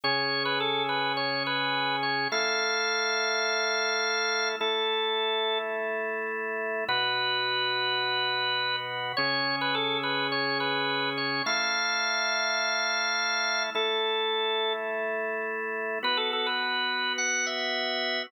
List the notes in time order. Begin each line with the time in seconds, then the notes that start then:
0.04 C#3 C#4 G#4 C#5
0.45 B4
0.60 A4
0.89 B4
1.17 C#5
1.46 B4
2.03 C#5
2.32 A3 E4 A4 F5
4.60 A3 E4 A4
6.88 B2 B3 F#4 B4
9.17 C#3 C#4 G#4 C#5
9.61 B4
9.75 A4
10.03 B4
10.32 C#5
10.60 B4
11.18 C#5
11.46 A3 E4 A4 F5
13.75 A3 E4 A4
16.03 B3 F#4 B4
16.17 A4
16.33 A4
16.46 B4
17.18 F#5
17.46 E5